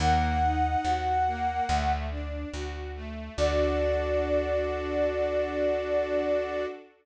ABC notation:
X:1
M:4/4
L:1/8
Q:1/4=71
K:D
V:1 name="Flute"
_g5 z3 | d8 |]
V:2 name="String Ensemble 1"
_B, _E _G B, A, D F A, | [DFA]8 |]
V:3 name="Electric Bass (finger)" clef=bass
_E,,2 E,,2 D,,2 D,,2 | D,,8 |]